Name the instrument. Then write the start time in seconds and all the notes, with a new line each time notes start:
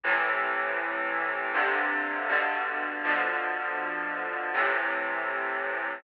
clarinet
0.04 A2 C3 E3
1.54 G2 C3 D3
2.29 G2 B2 D3
3.04 B2 D3 F3
4.54 A2 C3 E3